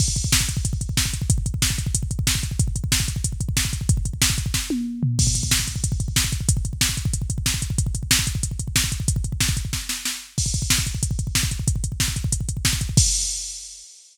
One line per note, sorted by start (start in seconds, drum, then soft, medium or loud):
0.00 kick medium
0.00 crash medium
0.08 kick medium
0.16 kick medium
0.16 closed hi-hat medium
0.24 kick medium
0.32 kick medium
0.32 snare loud
0.40 kick medium
0.49 kick medium
0.49 closed hi-hat medium
0.57 kick medium
0.65 kick medium
0.65 closed hi-hat medium
0.73 kick medium
0.81 kick medium
0.81 closed hi-hat medium
0.89 kick medium
0.97 kick medium
0.97 snare medium
1.05 kick medium
1.14 kick medium
1.14 closed hi-hat medium
1.22 kick medium
1.30 kick medium
1.30 closed hi-hat medium
1.38 kick medium
1.46 kick medium
1.46 closed hi-hat medium
1.54 kick medium
1.62 kick medium
1.62 snare medium
1.70 kick medium
1.78 kick medium
1.78 closed hi-hat medium
1.86 kick medium
1.95 kick medium
1.95 closed hi-hat medium
2.03 kick medium
2.11 kick medium
2.11 closed hi-hat medium
2.19 kick medium
2.27 kick medium
2.27 snare medium
2.35 kick medium
2.43 kick medium
2.43 closed hi-hat medium
2.51 kick medium
2.59 kick medium
2.59 closed hi-hat medium
2.68 kick medium
2.76 kick medium
2.76 closed hi-hat medium
2.84 kick medium
2.92 kick medium
2.92 snare medium
3.00 kick medium
3.08 kick medium
3.08 closed hi-hat medium
3.16 kick medium
3.24 kick medium
3.24 closed hi-hat medium
3.32 kick medium
3.41 kick medium
3.41 closed hi-hat medium
3.49 kick medium
3.57 kick medium
3.57 snare medium
3.65 kick medium
3.73 kick medium
3.73 closed hi-hat medium
3.81 kick medium
3.89 kick loud
3.89 closed hi-hat medium
3.97 kick medium
4.05 kick medium
4.05 closed hi-hat medium
4.13 kick medium
4.22 kick medium
4.22 snare loud
4.30 kick medium
4.38 kick medium
4.38 closed hi-hat medium
4.46 kick medium
4.54 kick medium
4.54 snare medium
4.70 high tom medium
5.03 floor tom medium
5.19 kick medium
5.19 crash medium
5.27 kick medium
5.35 kick medium
5.35 closed hi-hat medium
5.43 kick medium
5.51 kick medium
5.51 snare medium
5.59 kick medium
5.68 kick medium
5.68 closed hi-hat medium
5.76 kick medium
5.84 kick medium
5.84 closed hi-hat medium
5.92 kick medium
6.00 kick medium
6.00 closed hi-hat medium
6.08 kick medium
6.16 kick medium
6.16 snare medium
6.24 kick medium
6.32 kick medium
6.32 closed hi-hat medium
6.41 kick medium
6.49 kick medium
6.49 closed hi-hat loud
6.57 kick medium
6.65 kick medium
6.65 closed hi-hat medium
6.73 kick medium
6.81 kick medium
6.81 snare medium
6.89 kick medium
6.97 kick medium
6.97 closed hi-hat medium
7.05 kick medium
7.14 kick medium
7.14 closed hi-hat medium
7.22 kick medium
7.30 kick medium
7.30 closed hi-hat medium
7.38 kick medium
7.46 kick medium
7.46 snare medium
7.54 kick medium
7.62 kick medium
7.62 closed hi-hat medium
7.70 kick medium
7.78 kick medium
7.78 closed hi-hat medium
7.86 kick medium
7.95 kick medium
7.95 closed hi-hat medium
8.03 kick medium
8.11 kick medium
8.11 snare loud
8.19 kick medium
8.27 kick medium
8.27 closed hi-hat medium
8.35 kick medium
8.43 kick medium
8.43 closed hi-hat medium
8.51 kick medium
8.59 kick medium
8.59 closed hi-hat medium
8.68 kick medium
8.76 kick medium
8.76 snare medium
8.84 kick medium
8.92 kick medium
8.92 closed hi-hat medium
9.00 kick medium
9.08 kick medium
9.08 closed hi-hat medium
9.16 kick medium
9.24 kick medium
9.24 closed hi-hat medium
9.32 kick medium
9.40 kick medium
9.40 snare medium
9.49 kick medium
9.57 kick medium
9.57 closed hi-hat medium
9.65 kick medium
9.73 kick medium
9.73 snare medium
9.89 snare medium
10.05 snare medium
10.38 kick medium
10.38 crash medium
10.46 kick medium
10.54 kick medium
10.54 closed hi-hat medium
10.62 kick medium
10.70 kick medium
10.70 snare medium
10.78 kick medium
10.86 kick medium
10.86 closed hi-hat medium
10.95 kick medium
11.03 kick medium
11.03 closed hi-hat medium
11.11 kick medium
11.19 kick medium
11.19 closed hi-hat medium
11.27 kick medium
11.35 kick medium
11.35 snare medium
11.43 kick medium
11.51 kick medium
11.51 closed hi-hat medium
11.59 kick medium
11.68 kick medium
11.68 closed hi-hat medium
11.76 kick medium
11.84 kick medium
11.84 closed hi-hat medium
11.92 kick medium
12.00 kick medium
12.00 snare medium
12.08 kick medium
12.16 kick medium
12.16 closed hi-hat medium
12.24 kick medium
12.32 kick medium
12.32 closed hi-hat medium
12.41 kick medium
12.49 kick medium
12.49 closed hi-hat medium
12.57 kick medium
12.65 kick medium
12.65 snare medium
12.73 kick medium
12.81 kick medium
12.81 closed hi-hat medium
12.89 kick medium
12.97 kick loud
12.97 crash loud